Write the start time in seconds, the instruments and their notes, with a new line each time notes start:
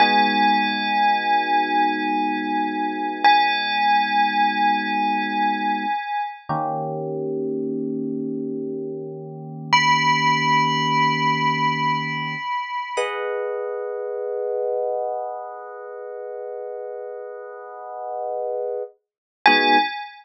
0.00 electric piano 1 G#3 B3 D#4 F#4, tubular bells G#5
3.24 tubular bells G#5
6.49 electric piano 1 D#3 A#3 C#4 G4
9.73 tubular bells B5
12.97 electric piano 1 G#4 B4 D#5 F#5
19.46 electric piano 1 G#3 B3 D#4 F#4, tubular bells G#5